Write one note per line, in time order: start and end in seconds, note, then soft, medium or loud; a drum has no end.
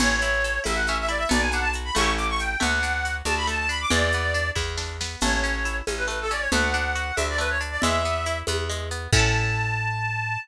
0.00 0.59 A1 medium
0.00 0.20 C#4 medium
0.00 0.61 C#5 loud
0.00 crash loud
0.00 low conga loud
0.00 shaker medium
0.21 0.42 E4 medium
0.21 shaker medium
0.44 0.64 A4 medium
0.44 shaker medium
0.64 1.26 A1 medium
0.64 0.83 E4 medium
0.64 0.77 E5 loud
0.64 high conga medium
0.64 shaker medium
0.76 0.86 F#5 loud
0.86 1.08 C#4 medium
0.86 0.97 E5 loud
0.86 shaker medium
1.00 1.10 E5 loud
1.08 1.28 E4 medium
1.08 1.19 D5 medium
1.08 shaker medium
1.18 1.28 E5 loud
1.29 1.91 B1 loud
1.29 1.49 B3 medium
1.29 1.41 D5 loud
1.29 low conga loud
1.29 shaker medium
1.41 1.52 G#5 medium
1.52 1.73 D4 medium
1.52 1.63 F#5 loud
1.52 shaker medium
1.61 1.72 A5 loud
1.73 1.95 F#4 medium
1.73 shaker medium
1.85 1.95 B5 medium
1.95 2.56 A1 medium
1.95 2.53 A3 medium
1.95 2.53 C#4 medium
1.95 2.13 C#6 loud
1.95 high conga medium
1.95 shaker medium
2.01 2.53 E4 medium
2.01 2.53 G4 medium
2.17 2.27 D6 medium
2.17 shaker medium
2.30 2.40 C#6 loud
2.39 2.60 G5 medium
2.39 shaker medium
2.60 3.22 D2 medium
2.60 2.80 A3 medium
2.60 3.15 F#5 loud
2.60 low conga medium
2.60 shaker medium
2.83 3.02 D4 medium
2.83 shaker medium
3.05 3.25 F#4 medium
3.05 shaker medium
3.25 3.85 D2 medium
3.25 3.46 D4 medium
3.25 3.35 A5 loud
3.25 high conga medium
3.25 shaker medium
3.37 3.47 B5 loud
3.47 3.67 A3 medium
3.47 3.58 A5 loud
3.47 shaker medium
3.59 3.69 A5 loud
3.69 3.89 D4 medium
3.69 3.80 B5 loud
3.69 shaker medium
3.81 3.91 D6 loud
3.90 4.51 E2 loud
3.90 4.10 G#3 medium
3.90 4.49 D5 loud
3.90 low conga loud
3.90 shaker medium
4.12 4.34 B3 medium
4.12 shaker medium
4.34 4.54 D4 medium
4.34 shaker medium
4.55 5.16 E2 medium
4.55 4.75 E4 medium
4.55 kick medium
4.55 snare medium
4.77 4.97 D4 medium
4.77 snare medium
5.01 5.20 B3 medium
5.01 snare loud
5.21 5.82 A1 medium
5.21 5.42 A3 medium
5.21 5.76 C#5 loud
5.21 crash medium
5.21 low conga loud
5.21 shaker medium
5.44 5.63 C#4 medium
5.44 shaker medium
5.65 5.85 E4 medium
5.65 shaker medium
5.87 6.48 A1 medium
5.87 6.07 C#4 medium
5.87 high conga medium
5.87 shaker medium
5.97 6.07 B4 medium
6.08 6.27 A3 medium
6.08 6.18 B4 medium
6.08 shaker medium
6.21 6.32 A4 loud
6.31 6.50 C#4 medium
6.31 6.41 D5 loud
6.31 shaker medium
6.40 6.50 C#5 loud
6.52 7.12 D2 medium
6.52 6.72 A3 medium
6.52 7.16 F#5 loud
6.52 low conga medium
6.52 shaker medium
6.74 6.93 D4 medium
6.74 shaker medium
6.95 7.15 F#4 medium
6.95 shaker medium
7.16 7.78 D2 medium
7.16 7.37 D4 medium
7.16 7.26 E5 medium
7.16 high conga medium
7.16 shaker medium
7.30 7.40 D5 loud
7.38 7.58 A3 medium
7.38 7.50 B4 loud
7.38 shaker medium
7.50 7.61 C#5 loud
7.61 7.80 D4 medium
7.61 shaker medium
7.71 7.81 D5 medium
7.81 8.43 E2 medium
7.81 8.03 G#3 medium
7.81 8.38 E5 loud
7.81 low conga loud
7.81 shaker medium
8.05 8.25 B3 medium
8.05 shaker medium
8.26 8.46 E4 medium
8.26 shaker medium
8.47 9.08 E2 medium
8.47 8.68 B3 medium
8.47 high conga loud
8.47 shaker medium
8.69 8.89 G#3 medium
8.69 shaker medium
8.91 9.11 B3 medium
8.91 shaker medium
9.13 10.37 A2 loud
9.13 10.38 C#4 loud
9.13 10.38 E4 loud
9.13 10.38 A5 loud
9.13 kick loud
9.13 crash loud
9.19 10.38 A4 loud